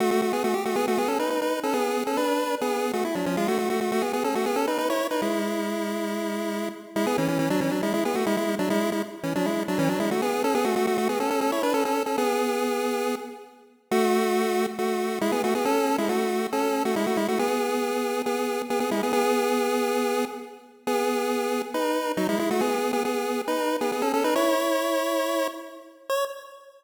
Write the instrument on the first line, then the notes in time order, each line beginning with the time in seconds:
lead 1 (square)
0.00 A3 F#4
0.11 A3 F#4
0.22 A3 F#4
0.33 B3 G#4
0.44 A3 F#4
0.54 G4
0.65 A3 F#4
0.76 B3 G#4
0.88 A3 F#4
0.98 B3 G#4
1.08 C#4 A4
1.19 D#4 B4
1.30 D#4 B4
1.42 D#4 B4
1.63 C#4 A4
1.73 B3 G#4
2.07 C#4 A4
2.17 D4 B4
2.61 B3 G#4
2.93 A3 F#4
3.05 E4
3.15 F#3 D4
3.26 F3 C#4
3.37 G#3 F4
3.48 A3 F#4
3.58 A3 F#4
3.70 A3 F#4
3.81 A3 F#4
3.92 A3 F#4
4.02 B3 G#4
4.13 B3 G#4
4.24 C#4 A4
4.35 A3 F#4
4.46 B3 G#4
4.56 C#4 A4
4.67 D#4 B4
4.78 D#4 B4
4.90 E4 C#5
5.11 D#4 B4
5.22 G#3 E4
6.96 G#3 E4
7.06 B3 G#4
7.18 E3 C#4
7.28 E3 C#4
7.39 E3 C#4
7.50 F#3 D4
7.61 E3 C#4
7.71 F#3 D4
7.83 G#3 E4
7.93 G#3 E4
8.05 B3 G#4
8.15 A3 F#4
8.26 G#3 E4
8.37 G#3 E4
8.59 F#3 D4
8.70 G#3 E4
8.92 G#3 E4
9.23 E3 C#4
9.35 F#3 D4
9.46 G#3 E4
9.68 F#3 D4
9.78 E3 C#4
9.89 F#3 D4
10.00 G#3 E4
10.11 A3 F#4
10.22 B3 G#4
10.44 C#4 A4
10.54 B3 G#4
10.64 A3 F#4
10.76 A3 F#4
10.87 A3 F#4
10.98 A3 F#4
11.09 B3 G#4
11.20 C#4 A4
11.30 C#4 A4
11.41 C#4 A4
11.52 E4 C#5
11.63 D4 B4
11.74 C#4 A4
11.85 C#4 A4
12.06 C#4 A4
12.18 B3 G#4
13.91 A3 F#4
14.78 A3 F#4
15.21 G#3 E4
15.32 B3 G#4
15.44 A3 F#4
15.55 B3 G#4
15.65 C#4 A4
15.98 G#3 E4
16.09 A3 F#4
16.52 C#4 A4
16.85 A3 F#4
16.96 G#3 E4
17.07 A3 F#4
17.17 G#3 E4
17.28 A3 F#4
17.39 B3 G#4
18.26 B3 G#4
18.70 B3 G#4
18.80 B3 G#4
18.91 G#3 E4
19.03 B3 G#4
19.13 B3 G#4
20.87 B3 G#4
21.74 D#4 B4
22.17 F#3 D#4
22.29 G#3 E4
22.39 G#3 E4
22.51 A3 F#4
22.61 B3 G#4
22.93 B3 G#4
23.05 B3 G#4
23.47 D#4 B4
23.81 B3 G#4
23.92 B3 G#4
24.02 C#4 A4
24.13 C#4 A4
24.24 D#4 B4
24.35 E4 C#5
26.09 C#5